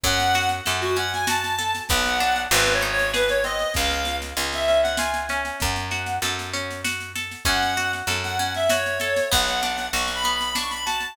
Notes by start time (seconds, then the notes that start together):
0.03 F#2 C#4 F#5, kick, snare
0.19 snare
0.35 F#4, snare
0.49 snare
0.65 F#2 A4, snare
0.81 F#4, snare
0.96 C#4 F#5, snare
1.13 G#5, snare
1.27 F#4 A5, snare
1.44 snare
1.59 A4, snare
1.75 snare
1.89 B1 B3 F#5, kick, snare
2.06 snare
2.20 D4, snare
2.36 snare
2.51 G#1 C4 B4, snare
2.67 snare
2.73 C#5
2.81 D#4, snare
2.92 C#5
2.99 snare
3.14 G#4 B4, snare
3.29 C#5, snare
3.44 C4 D#5, snare
3.59 snare
3.74 C#2 C#4 F5, kick, snare
3.91 snare
4.05 F4, snare
4.22 snare
4.37 C#2 G#4, snare
4.52 E5, snare
4.67 C#4 E5, snare
4.83 F#5, snare
4.97 F4 G#5, snare
5.14 snare
5.29 C#4, snare
5.45 snare
5.60 F#2 F#5, kick, snare
5.76 snare
5.91 F#4, snare
6.06 snare
6.22 F#2 A4, snare
6.39 snare
6.53 C#4, snare
6.70 snare
6.84 F#4, snare
7.00 snare
7.15 A4, snare
7.31 snare
7.45 F#2 C#4 F#5, kick, snare
7.62 snare
7.77 F#4, snare
7.93 snare
8.07 F#2 A4, snare
8.24 F#5, snare
8.38 C#4 F#5, snare
8.54 E5, snare
8.69 F#4 C#5, snare
8.86 snare
9.00 A4, snare
9.16 snare
9.31 B1 B3 F#5, kick, snare
9.48 snare
9.63 D4, snare
9.78 snare
9.93 B1 F#4 C#6, snare
10.08 snare
10.15 B5
10.24 B3, snare
10.35 B5
10.41 snare
10.55 D4 C#6, snare
10.70 B5, snare
10.85 F#4 A5, snare
11.00 snare